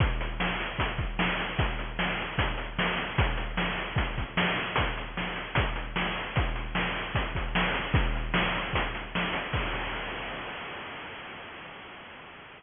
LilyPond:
\new DrumStaff \drummode { \time 4/4 \tempo 4 = 151 <hh bd>8 hh8 sn8 hh8 <hh bd>8 <hh bd>8 sn8 hh8 | <hh bd>8 hh8 sn8 hh8 <hh bd>8 hh8 sn8 hh8 | <hh bd>8 hh8 sn8 hh8 <hh bd>8 <hh bd>8 sn8 hh8 | <hh bd>8 hh8 sn8 hh8 <hh bd>8 hh8 sn8 hh8 |
<hh bd>8 hh8 sn8 hh8 <hh bd>8 <hh bd>8 sn8 hh8 | <hh bd>8 hh8 sn8 hh8 <hh bd>8 hh8 sn8 hh8 | <cymc bd>4 r4 r4 r4 | }